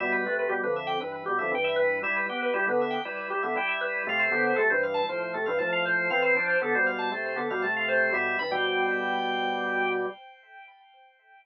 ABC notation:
X:1
M:4/4
L:1/16
Q:1/4=118
K:Ephr
V:1 name="Drawbar Organ"
e B2 B G B e g B B G e g e B2 | e B2 B G B e g B B G e g e B2 | f c2 c A c f a c c A f a f c2 | f c2 c A c f a c c A f a f c2 |
e2 b g13 |]
V:2 name="Drawbar Organ"
[B,,G,]2 [C,A,]2 [B,,G,] [F,,D,]3 [G,,E,]2 [B,,G,] [F,,D,] [G,,E,]4 | [G,E]2 [B,G]2 [G,E] [D,B,]3 [G,E]2 [G,E] [D,B,] [G,E]4 | [C,A,]2 [D,B,]2 [C,A,] [G,,E,]3 [A,,F,]2 [C,A,] [G,,E,] [A,,F,]4 | [E,C]2 [F,D]2 [D,B,] [B,,G,]3 [C,A,]2 [D,B,] [B,,G,] [C,A,]4 |
[B,,G,]2 [G,,E,] [B,,G,]13 |]